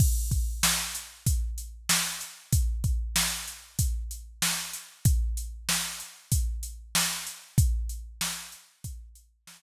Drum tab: CC |x-------|--------|--------|--------|
HH |-x-xxx-x|xx-xxx-x|xx-xxx-x|xx-xxx--|
SD |--o---o-|--o---o-|--o---o-|--o---o-|
BD |oo--o---|oo--o---|o---o---|o---o---|